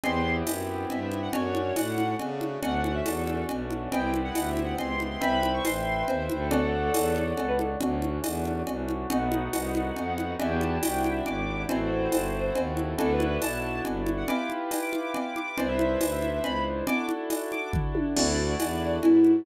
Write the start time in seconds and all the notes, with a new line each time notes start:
0.04 E2 B3 C4 E4 G4 C6, cowbell, low conga
0.47 F#2, tambourine, cowbell, high conga
0.90 G2 E5, cowbell, low conga
1.12 high conga
1.22 F#5
1.33 F#2 A3 C#4 D4 F#4 C#5, cowbell, low conga
1.55 high conga
1.76 A2 F#5, tambourine, cowbell, high conga
1.98 high conga
2.19 C#3, cowbell, low conga
2.41 high conga
2.63 D2 A3 C#4 D4 F#4 F#5, cowbell, low conga
2.84 F#5, high conga
2.95 E5
3.06 E2 A4, tambourine, cowbell, high conga
3.27 high conga
3.49 B1, cowbell, low conga
3.71 high conga
3.92 C2 B3 C4 E4 G4 G5, cowbell, low conga
4.14 high conga
4.24 F#5
4.35 D2 F#5, tambourine, cowbell, high conga
4.50 E5
4.57 high conga
4.64 F#5
4.78 C#2 C6, cowbell, low conga
5.00 high conga
5.11 C6
5.21 C2 B4 C5 E5 G5 B5, cowbell, low conga
5.43 high conga
5.54 C#6
5.65 A1 C6, tambourine, cowbell, high conga
6.08 D#2 C5, cowbell, low conga
6.29 D2, high conga
6.40 A4
6.51 A4 C#5 D5 F#5, cowbell, low conga
6.94 E2, tambourine, cowbell, high conga
7.16 high conga
7.37 C#2 A4, cowbell, low conga
7.48 B4
7.59 A4, high conga
7.81 D2 A3 C#4 D4 F#4 C#5, cowbell, low conga
8.02 high conga
8.24 E2, tambourine, cowbell, high conga
8.45 high conga
8.67 C2, cowbell, low conga
8.88 high conga
9.10 B1 A3 B3 D#4 F#4 F#5, cowbell, low conga
9.32 high conga
9.53 C2, tambourine, cowbell, high conga
9.75 high conga
9.96 F2, cowbell, low conga
10.18 high conga
10.39 E2 D4 E4 F#4 G4 E5, cowbell, low conga
10.50 G5
10.61 A5, high conga
10.83 C2 G5, tambourine, cowbell, high conga
10.97 G5
11.04 high conga
11.12 E5
11.26 G#1 D6, cowbell, low conga
11.69 A1 C4 E4 F#4 A4 C5, cowbell, low conga
12.12 G1, tambourine, cowbell, high conga
12.55 D#2, cowbell, low conga
12.77 high conga
12.98 D2 D4 E4 F#4 A4, cowbell, low conga
13.13 B4
13.20 high conga
13.27 B4
13.42 B1 A5, tambourine, cowbell, high conga
13.85 G1, cowbell, low conga
14.06 high conga
14.17 F#5
14.28 E4 F4 G4 B4 D6, cowbell, low conga
14.50 high conga
14.71 tambourine, cowbell, high conga
14.82 D6
14.93 high conga
15.14 D6, cowbell, low conga
15.36 D6, high conga
15.47 D6
15.58 C2 D4 E4 B4 C5 D5, cowbell, low conga
15.68 E5
15.79 E5, high conga
16.01 D2, tambourine, cowbell, high conga
16.12 E5
16.22 high conga
16.33 E5
16.44 C#2 B5, cowbell, low conga
16.87 D4 E4 F#4 A4 D6, cowbell, low conga
17.09 high conga
17.30 tambourine, cowbell, high conga
17.52 D6, high conga
17.73 kick, floor tom
17.95 high tom
18.16 D2 D4 E4 F#4 A4 D5, crash, cowbell, low conga
18.60 E2, tambourine, cowbell, high conga
19.03 G#2 E4, cowbell, low conga
19.24 high conga